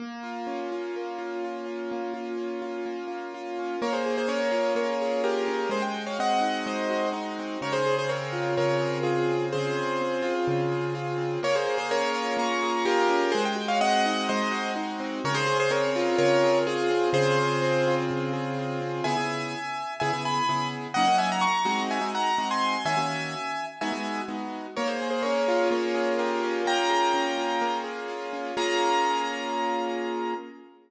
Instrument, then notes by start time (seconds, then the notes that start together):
acoustic grand piano
0.00 A#3
0.23 F4
0.47 C#4
0.72 F4
0.96 A#3
1.19 F4
1.44 F4
1.66 C#4
1.92 A#3
2.14 F4
2.37 C#4
2.62 F4
2.86 A#3
3.08 F4
3.34 F4
3.59 C#4
3.82 A#3 A#4 C#5
3.93 G#4 C5
4.06 G#4
4.18 G#4 C5
4.28 C#4 A#4 C#5
4.52 F4
4.75 A#3 A#4 C#5
5.02 G#4
5.24 F4 G4 A#4
5.48 C#4
5.69 G#3 G#4 C5
5.82 G5
5.94 F#4
6.06 C#5 F5
6.19 C4 D#5 F#5
6.41 D#4
6.66 G#3 C5 D#5
6.90 F#4
7.13 D#4
7.39 C4
7.61 C#3 A#4 C#5
7.73 G#4 C5
7.86 G#4
7.99 G#4 C5
8.08 C4 A#4 C#5
8.33 F4
8.57 C#3 A#4 C#5
8.82 G#4
9.03 F4 G#4
9.30 C4
9.52 C#3 G#4 C5
9.76 G#4
10.01 C4
10.22 F4
10.48 C#3
10.72 G#4
10.95 F4
11.18 C4
11.43 A#3 A#4 C#5
11.55 G#4 C5
11.66 G#4
11.78 G#4 C5
11.91 C#4 A#4 C#5
12.14 F4
12.37 A#3 A#5 C#6
12.63 G#4
12.85 F4 G4 A#4
13.09 C#4
13.32 G#3 G#4 C5
13.45 G5
13.55 F#4
13.68 C#5 F5
13.81 C4 D#5 F#5
14.06 D#4
14.29 G#3 C5 D#5
14.51 F#4
14.76 D#4
15.00 C4
15.24 C#3 A#4 C#5
15.35 G#4 C5
15.47 G#4
15.60 G#4 C5
15.71 C4 A#4 C#5
15.96 F4
16.18 C#3 A#4 C#5
16.43 G#4
16.67 F4 G#4
16.91 C4
17.13 C#3 G#4 C5
17.38 G#4
17.62 C4
17.87 F4
18.11 C#3
18.33 G#4
18.59 F4
18.81 C4
19.04 C#3 B3 E4 G#4 E5 G#5
19.17 C#3 B3 E4 G#4
20.00 C#3 B3 E4 G#4 E5 G#5
20.13 C#3 B3 E4 G#4
20.25 G#5 B5
20.49 C#3 B3 E4 G#4
20.94 F#3 A#3 C#4 D#4 D#5 F#5
21.08 F#3 A#3 C#4 D#4
21.18 E5 G#5
21.32 F#5 A#5
21.41 A#5 C#6
21.65 G#3 C4 D#4 F#4
21.91 E5 G#5
22.01 G#3 C4 D#4 F#4
22.15 F#5 A#5
22.38 G#3 C4 D#4 F#4
22.51 G#5 C6
22.85 D#3 A#3 C#4 F#4 E5 G#5
22.97 D#3 A#3 C#4 F#4
23.81 G#3 B3 D#4 F#4 E5 G#5
23.92 G#3 B3 D#4 F#4
24.28 G#3 B3 D#4 F#4
24.76 A#3 A#4 C#5
24.87 G#4 C5
25.02 G#4
25.10 G#4 C5
25.23 C#4 A#4 C#5
25.48 F4
25.71 A#3 A#4 C#5
25.95 G#4
26.18 F4 G4 A#4
26.43 C#4
26.66 A#3 G5 A#5
26.90 G#4
27.14 C#4
27.38 F4
27.61 A#3
27.84 G#4
28.09 F4
28.33 C#4
28.57 A#3 C#4 F4 G#4 A#5